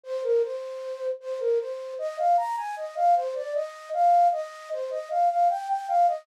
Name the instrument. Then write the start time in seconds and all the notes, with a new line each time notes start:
flute
0.04 C5
0.23 A#4
0.43 C5
1.20 C5
1.40 A#4
1.59 C5
1.99 D#5
2.18 F5
2.37 A#5
2.56 G#5
2.76 D#5
2.96 F5
3.15 C5
3.35 D5
3.54 D#5
3.93 F5
4.32 D#5
4.71 C5
4.90 D#5
5.10 F5
5.29 F5
5.49 G5
5.69 G5
5.88 F5
6.07 D#5